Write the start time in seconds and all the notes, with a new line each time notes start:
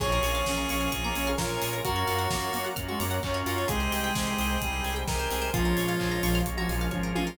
0.00 A#1 A#3 C#4 F4 G#4 A#4 C#5 F5 G#5, kick, crash
0.12 A#4
0.23 A#1 C#5, open hi-hat
0.35 F5
0.46 A#1 A#3 C#4 F4 G#4 G#5, kick, snare
0.57 A#5
0.69 A#1 C#4 C#6, open hi-hat
0.81 F6
0.92 A#1 A#3 C#4 F4 G#4 A#4 C#5 G#5 A#5 C#6, kick, closed hi-hat
1.04 A#3 A#5
1.15 A#1 C#4 G#5, open hi-hat
1.27 F5
1.38 A#1 A#3 C#4 F4 G#4 A#4 C#5, kick, snare
1.49 A#4
1.62 A#1 G#4, open hi-hat
1.73 A#4
1.85 F#2 A#3 C#4 F4 F#4 A#4 C#5 F5 F#5, kick, closed hi-hat
1.96 C#5
2.07 F#2 F5, open hi-hat
2.19 F#5
2.30 F#2 A#3 C#4 F4 F#4 A#5, kick, snare
2.42 C#6
2.53 F#2 A#3 F6, open hi-hat
2.64 F#6
2.76 F#2 A#3 C#4 F4 F#4 A#4 C#5 F#5 A#5 F6, kick, closed hi-hat
2.88 G#3 F#4 C#6
3.00 F#2 A#3 A#5, open hi-hat
3.11 F#5
3.23 F#2 A#3 C#4 F4 F#4 F5, kick, clap
3.34 C#5
3.46 F#2 F4 A#4, open hi-hat
3.58 C#5
3.68 C2 G#3 C4 D#4 G4 G#4 C5 D#5 G5, kick, closed hi-hat
3.80 C5
3.92 C2 D#5, open hi-hat
4.04 G5
4.15 C2 G#3 C4 D#4 G4 G#5, kick, snare
4.27 C6
4.38 C2 D#6, open hi-hat
4.50 G6
4.61 C2 G3 G#3 C4 D#4 G4 G#4 C5 G5 G#5 D#6, kick, closed hi-hat
4.73 C6
4.84 C2 G#5, open hi-hat
4.96 G5
5.07 C2 G#3 C4 D#4 G4 A#4 D#5, kick, snare
5.19 C5
5.31 C2 G#4, open hi-hat
5.42 C5
5.54 A#1 F3 G#3 A#3 C#4 F4 G#4 A#4 C#5 F5, kick, closed hi-hat
5.65 A#4
5.77 A#1 C#5, open hi-hat
5.88 F5
6.00 A#1 F3 G#3 A#3 C#4 F4 G#5, kick, clap
6.11 A#5
6.23 A#1 F3 C#6, open hi-hat
6.35 F6
6.46 A#1 G#3 A#3 C#4 F4 G#4 A#4 F5 G#5 C#6, kick, closed hi-hat
6.57 F3 F#4 A#5
6.69 A#1 F3 G#5, open hi-hat
6.81 F5
6.91 G#1 F3 G#3 A#3 C#4 F4 C#5, kick, high tom
7.03 A#4
7.15 A1 F4 G#4, high tom
7.27 A#4